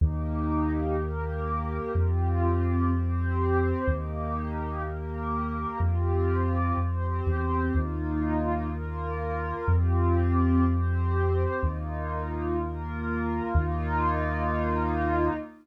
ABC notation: X:1
M:6/8
L:1/16
Q:3/8=62
K:Eblyd
V:1 name="Pad 2 (warm)"
[B,EG]6 [B,GB]6 | [CFG]6 [CGc]6 | [B,EG]6 [B,GB]6 | [CFG]6 [CGc]6 |
[B,EF]6 [B,FB]6 | [CFG]6 [CGc]6 | [B,EF]6 [B,FB]6 | [B,EF]12 |]
V:2 name="Synth Bass 2" clef=bass
E,,12 | F,,12 | E,,12 | F,,6 F,,3 =E,,3 |
E,,12 | F,,12 | E,,12 | E,,12 |]